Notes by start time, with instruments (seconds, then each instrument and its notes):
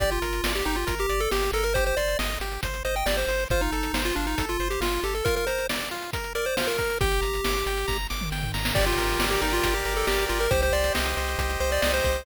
0.00 synth bass 1 G1, lead 1 (square) G4 D5, kick, closed hi-hat
0.11 lead 1 (square) F4, closed hi-hat
0.22 synth bass 1 G1, lead 1 (square) A#4, closed hi-hat
0.33 closed hi-hat
0.44 synth bass 1 G1, lead 1 (square) D5, snare
0.55 lead 1 (square) G4, closed hi-hat
0.65 synth bass 1 G1, lead 1 (square) D#4 G4, closed hi-hat
0.76 lead 1 (square) F4, closed hi-hat
0.87 synth bass 1 G1, lead 1 (square) A#4, kick, closed hi-hat
0.99 lead 1 (square) G4, closed hi-hat
1.09 synth bass 1 G1, lead 1 (square) D5, closed hi-hat
1.20 lead 1 (square) A4, closed hi-hat
1.31 synth bass 1 G1, lead 1 (square) G4, snare
1.43 closed hi-hat
1.52 synth bass 1 G1, lead 1 (square) A4 A#4, closed hi-hat
1.64 lead 1 (square) A#4, closed hi-hat
1.74 lead 1 (square) G4 C5, kick, closed hi-hat
1.86 lead 1 (square) C5, closed hi-hat
1.97 synth bass 1 G1, lead 1 (square) C5 D5, closed hi-hat
2.08 closed hi-hat
2.19 synth bass 1 G1, lead 1 (square) D#5, snare
2.30 closed hi-hat
2.40 synth bass 1 G1, lead 1 (square) G4, closed hi-hat
2.52 closed hi-hat
2.63 synth bass 1 G1, lead 1 (square) C5, kick, closed hi-hat
2.74 closed hi-hat
2.85 synth bass 1 G1, lead 1 (square) C5 D#5, closed hi-hat
2.96 lead 1 (square) G5, closed hi-hat
3.06 synth bass 1 G1, lead 1 (square) G4 D5, snare
3.17 lead 1 (square) C5, closed hi-hat
3.27 synth bass 1 G1, lead 1 (square) C5, closed hi-hat
3.39 closed hi-hat
3.50 synth bass 1 G1, lead 1 (square) F4 C5, kick, closed hi-hat
3.61 lead 1 (square) D#4, closed hi-hat
3.72 synth bass 1 G1, lead 1 (square) A4, closed hi-hat
3.83 closed hi-hat
3.93 synth bass 1 G1, lead 1 (square) C5, snare
4.05 lead 1 (square) F4, closed hi-hat
4.16 synth bass 1 G1, lead 1 (square) D4 F4, closed hi-hat
4.27 lead 1 (square) D#4, closed hi-hat
4.38 synth bass 1 G1, lead 1 (square) A4, kick, closed hi-hat
4.49 lead 1 (square) F4, closed hi-hat
4.59 synth bass 1 G1, lead 1 (square) C5, closed hi-hat
4.70 lead 1 (square) G4, closed hi-hat
4.80 synth bass 1 G1, lead 1 (square) F4, snare
4.93 closed hi-hat
5.03 synth bass 1 G1, lead 1 (square) G4 A4, closed hi-hat
5.15 lead 1 (square) A4, closed hi-hat
5.25 lead 1 (square) F4 A#4, kick, closed hi-hat
5.36 lead 1 (square) A#4, closed hi-hat
5.47 lead 1 (square) A#4 C5, closed hi-hat
5.58 closed hi-hat
5.69 lead 1 (square) D5, snare
5.80 closed hi-hat
5.91 lead 1 (square) F4, closed hi-hat
6.02 closed hi-hat
6.13 lead 1 (square) A#4, kick, closed hi-hat
6.24 closed hi-hat
6.35 lead 1 (square) A#4 D5, closed hi-hat
6.46 lead 1 (square) C5, closed hi-hat
6.57 lead 1 (square) F4 C5, snare
6.67 lead 1 (square) A#4, closed hi-hat
6.78 lead 1 (square) A#4, kick, closed hi-hat
6.90 closed hi-hat
7.01 synth bass 1 G1, lead 1 (square) G4 G5, kick, closed hi-hat
7.12 closed hi-hat
7.22 synth bass 1 G1, lead 1 (square) A#5, closed hi-hat
7.34 closed hi-hat
7.44 synth bass 1 G1, lead 1 (square) D6, snare
7.55 closed hi-hat
7.66 synth bass 1 G1, lead 1 (square) G5, closed hi-hat
7.77 closed hi-hat
7.88 synth bass 1 G1, lead 1 (square) A#5, kick, snare
8.10 synth bass 1 G1, lead 1 (square) D6, snare
8.21 mid tom
8.31 synth bass 1 G1, lead 1 (square) G5, snare
8.43 floor tom
8.54 synth bass 1 G1, lead 1 (square) A#5, snare
8.65 snare
8.75 synth bass 1 G1, lead 1 (square) G4 D5, kick, crash
8.86 lead 1 (square) F4, closed hi-hat
8.98 synth bass 1 G1, lead 1 (square) A#4, closed hi-hat
9.09 closed hi-hat
9.19 synth bass 1 G1, lead 1 (square) D5, snare
9.30 lead 1 (square) G4, closed hi-hat
9.41 synth bass 1 G1, lead 1 (square) D#4 A#4, closed hi-hat
9.53 lead 1 (square) F4, closed hi-hat
9.64 synth bass 1 G1, lead 1 (square) G4, kick, closed hi-hat
9.74 lead 1 (square) G4, closed hi-hat
9.85 synth bass 1 G1, lead 1 (square) A#4, closed hi-hat
9.97 lead 1 (square) A4
10.07 synth bass 1 G1, lead 1 (square) G4 D5, snare
10.18 closed hi-hat
10.29 synth bass 1 G1, lead 1 (square) F4 A#4, closed hi-hat
10.40 lead 1 (square) A#4, closed hi-hat
10.51 synth bass 1 C2, lead 1 (square) G4 C5, kick, closed hi-hat
10.62 lead 1 (square) C5, closed hi-hat
10.72 synth bass 1 C2, lead 1 (square) C5 D5, closed hi-hat
10.84 closed hi-hat
10.95 synth bass 1 C2, lead 1 (square) D#5, snare
11.06 closed hi-hat
11.17 synth bass 1 C2, lead 1 (square) C5, closed hi-hat
11.28 closed hi-hat
11.38 synth bass 1 C2, lead 1 (square) G4, kick, closed hi-hat
11.50 closed hi-hat
11.60 synth bass 1 C2, lead 1 (square) C5, closed hi-hat
11.71 lead 1 (square) D5, closed hi-hat
11.82 synth bass 1 C2, lead 1 (square) D5 D#5, snare
11.93 lead 1 (square) C5, closed hi-hat
12.04 synth bass 1 C2, lead 1 (square) C5, kick, closed hi-hat
12.15 closed hi-hat